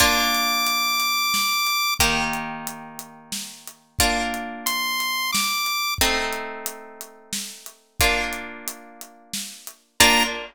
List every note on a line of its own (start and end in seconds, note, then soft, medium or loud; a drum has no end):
0.00 1.96 A#3 medium
0.00 1.96 D4 medium
0.00 1.96 F4 medium
0.00 1.94 D6 medium
0.00 kick loud
0.00 closed hi-hat loud
0.35 closed hi-hat medium
0.67 closed hi-hat loud
1.00 closed hi-hat loud
1.34 snare loud
1.67 closed hi-hat medium
1.99 3.96 D#3 medium
1.99 3.96 A#3 medium
1.99 3.96 G4 medium
1.99 kick loud
1.99 closed hi-hat loud
2.33 closed hi-hat medium
2.67 closed hi-hat loud
2.99 closed hi-hat medium
3.32 snare loud
3.67 closed hi-hat medium
3.99 5.96 A#3 medium
3.99 5.96 D4 medium
3.99 5.96 F4 medium
3.99 kick loud
3.99 closed hi-hat loud
4.34 closed hi-hat medium
4.66 5.31 C6 medium
4.66 closed hi-hat loud
5.00 closed hi-hat medium
5.32 5.94 D6 medium
5.32 snare loud
5.66 closed hi-hat medium
5.98 7.97 A3 medium
5.98 7.97 C4 medium
5.98 7.97 D#4 medium
5.98 kick loud
5.98 closed hi-hat loud
6.33 closed hi-hat medium
6.66 closed hi-hat loud
7.01 closed hi-hat medium
7.33 snare loud
7.66 closed hi-hat medium
8.00 9.97 A#3 medium
8.00 9.97 D4 medium
8.00 9.97 F4 medium
8.00 kick loud
8.00 closed hi-hat loud
8.33 closed hi-hat medium
8.68 closed hi-hat loud
9.01 closed hi-hat medium
9.33 snare loud
9.67 closed hi-hat medium
10.00 10.24 A#3 loud
10.00 10.24 D4 loud
10.00 10.24 F4 loud
10.00 10.23 A#5 loud
10.00 kick loud
10.00 crash loud